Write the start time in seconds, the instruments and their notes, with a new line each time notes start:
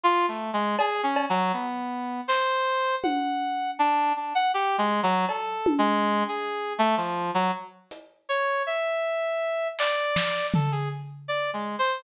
0.04 brass section F4
0.28 brass section A3
0.53 brass section G#3
0.79 brass section G#4, cowbell
1.03 brass section C#4
1.16 cowbell
1.30 brass section F#3
1.53 brass section B3
2.28 brass section C5, clap
3.03 brass section F#5, high tom
3.79 brass section D4
4.16 brass section D4
4.35 brass section F#5
4.54 brass section G4
4.78 brass section G#3
5.03 brass section F#3
5.29 brass section A4, cowbell
5.66 high tom
5.78 brass section G#3
6.28 brass section G#4
6.79 brass section A3
6.97 brass section F3
7.34 brass section F#3
7.91 closed hi-hat
8.29 brass section C#5
8.67 brass section E5
9.79 brass section D5, clap
10.16 snare
10.54 brass section A4, floor tom
10.72 brass section G#4
11.28 brass section D5
11.53 brass section G#3
11.79 brass section C5